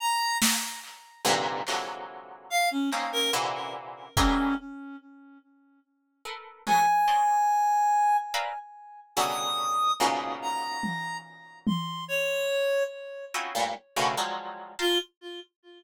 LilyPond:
<<
  \new Staff \with { instrumentName = "Orchestral Harp" } { \time 6/4 \tempo 4 = 72 r4. <g, aes, bes, c d>8 <c d e f ges aes>4. <bes c' des' ees'>8 <bes, c d e>4 <e ges g aes a>8 r8 | r4. <a' bes' b'>8 <ges aes a b>16 r16 <c'' des'' d'' ees''>8 r4 <bes' b' c'' d'' e'' f''>16 r8. <b, des d e ges g>4 | <ges, aes, bes, b, des>1 <c' des' ees' e' f' ges'>16 <g, a, bes,>16 r16 <a, b, des d ees e>16 <f ges g aes>8. <f'' g'' a'' bes'' c'''>16 | }
  \new Staff \with { instrumentName = "Clarinet" } { \time 6/4 bes''8 r2 r8 f''16 des'16 r16 bes'16 r4 des'8 r8 | r2 aes''2 r4 ees'''4 | r8 bes''4 r8 c'''8 des''4 r2 r16 f'16 | }
  \new DrumStaff \with { instrumentName = "Drums" } \drummode { \time 6/4 r8 sn8 hc8 tommh8 hc4 r8 hc8 r4 bd4 | r4 r4 tommh4 r4 r4 r4 | r4 tommh4 tommh4 r4 r4 cb4 | }
>>